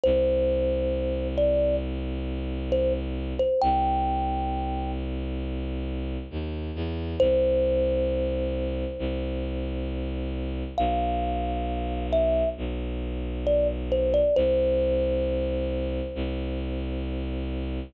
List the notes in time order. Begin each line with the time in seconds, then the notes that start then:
0.04 C2 C5
1.38 D5
2.72 C5
3.39 C5
3.62 C2 G5
6.31 D#2
6.75 E2
7.20 C2 C5
8.99 C2
10.78 B1 F5
12.13 E5
12.57 B1
13.47 D5
13.92 C5
14.14 D5
14.36 C2 C5
16.15 C2